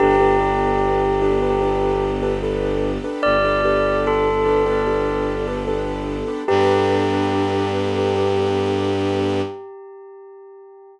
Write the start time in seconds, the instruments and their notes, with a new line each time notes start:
0.00 violin G1, string ensemble 1 B3 D4 G4 A4, acoustic grand piano D4 G4 A4 B4, tubular bells G4
0.20 acoustic grand piano D4 G4 A4 B4
0.40 acoustic grand piano D4 G4 A4 B4
1.22 acoustic grand piano D4 G4 A4 B4
1.42 acoustic grand piano D4 G4 A4 B4
1.62 acoustic grand piano D4 G4 A4 B4
2.23 acoustic grand piano D4 G4 A4 B4
2.43 acoustic grand piano D4 G4 A4 B4
3.04 acoustic grand piano D4 G4 A4 B4
3.23 violin G1, tubular bells D5
3.45 acoustic grand piano D4 G4 A4 B4
3.65 acoustic grand piano D4 G4 A4 B4
4.07 tubular bells A4
4.46 acoustic grand piano D4 G4 A4 B4
4.66 acoustic grand piano D4 G4 A4 B4
4.86 acoustic grand piano D4 G4 A4 B4
5.47 acoustic grand piano D4 G4 A4 B4
5.68 acoustic grand piano D4 G4 A4 B4
6.28 acoustic grand piano D4 G4 A4 B4
6.48 violin G2, string ensemble 1 B3 D4 G4 A4, acoustic grand piano D4 G4 A4 B4, tubular bells G4